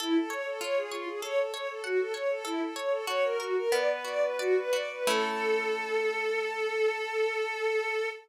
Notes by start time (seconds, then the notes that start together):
0.00 E4 A4
0.15 A4
0.30 C#5
0.46 A4
0.61 F4 C#5
0.77 G#4
0.91 F4 C#5
1.07 G#4
1.22 A4 C#5
1.38 A4
1.53 C#5
1.68 A4
1.84 F#4 F#5
1.99 A4
2.14 C#5
2.30 A4
2.45 E4 A4
2.60 A4
2.76 C#5
2.91 A4
3.07 F#4 C#5
3.23 A#4
3.39 F#4 A#4
3.55 A#4
3.72 B3 D5
3.88 B4
4.05 F#4 D5
4.22 B4
4.38 F#4 D5
4.56 B4
4.73 F#4 D5
4.90 B4
5.07 A3 C#4 E4 A4